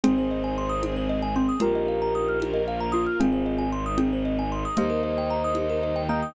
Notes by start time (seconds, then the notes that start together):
0.04 G#1 C4 D#4 G#4 C5, low conga
0.18 C5
0.31 D#5
0.44 G#5
0.58 C6
0.69 D#6
0.82 G#3 C4 G#4, high conga
0.96 C5
1.09 D#5
1.22 G#5
1.36 C4 C6
1.49 D#6
1.60 A#1 A#3 D#4 F4 G4 A#4, low conga
1.75 D#5
1.88 F5
2.02 A#5
2.15 D#6
2.29 F6
2.40 A#3 F4 A#4, high conga
2.54 D#5
2.68 F5
2.80 A#5
2.92 F4 D#6
3.06 F6
3.19 G#1 G#3 C4 D#4 F4 G#4, low conga
3.32 C5
3.46 D#5
3.58 G#5
3.72 C6
3.86 D#6
3.98 G#3 C4 D#4 G#4, high conga
4.13 C5
4.25 D#5
4.39 G#5
4.52 C6
4.65 D#6
4.77 D#2 G3 A#3 D#4 G4 C5 D#5, low conga
4.90 A#4
5.03 D#5
5.18 G5
5.30 A#5
5.44 D#6
5.55 D#3 G3 D#4 G4, high conga
5.70 A#4
5.83 D#5
5.96 G5
6.09 A#3 D#5 G5 A#5
6.22 D#6